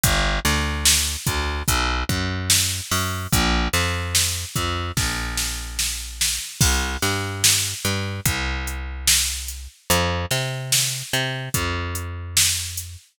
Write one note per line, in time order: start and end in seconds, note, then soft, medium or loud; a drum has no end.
0.04 0.40 G1 medium
0.04 kick loud
0.04 closed hi-hat loud
0.45 1.17 D2 medium
0.45 snare medium
0.45 closed hi-hat medium
0.85 snare loud
1.27 1.63 D2 medium
1.27 kick medium
1.27 closed hi-hat medium
1.68 2.04 B1 medium
1.68 kick medium
1.68 closed hi-hat loud
2.09 2.81 F#2 medium
2.09 kick medium
2.09 closed hi-hat medium
2.50 snare loud
2.91 3.27 F#2 medium
2.91 open hi-hat medium
3.33 3.68 A#1 medium
3.33 kick loud
3.33 closed hi-hat loud
3.73 4.45 F2 medium
3.73 snare medium
3.73 closed hi-hat medium
4.15 snare loud
4.56 4.92 F2 medium
4.56 kick medium
4.56 closed hi-hat medium
4.97 6.39 A#1 medium
4.97 kick medium
4.97 snare medium
5.38 snare medium
5.79 snare medium
6.21 snare loud
6.61 6.97 C2 medium
6.61 kick loud
6.61 crash loud
7.02 7.74 G2 medium
7.02 snare medium
7.02 closed hi-hat medium
7.44 snare loud
7.85 8.21 G2 medium
7.85 closed hi-hat medium
8.26 9.68 C2 medium
8.26 kick loud
8.26 closed hi-hat loud
8.67 closed hi-hat medium
9.08 snare loud
9.48 closed hi-hat medium
9.90 10.26 F2 medium
9.90 closed hi-hat loud
10.31 11.03 C3 medium
10.31 snare medium
10.31 closed hi-hat medium
10.72 snare loud
11.13 11.49 C3 medium
11.13 closed hi-hat medium
11.54 12.97 F2 medium
11.54 kick medium
11.54 closed hi-hat loud
11.95 closed hi-hat medium
12.37 snare loud
12.77 closed hi-hat medium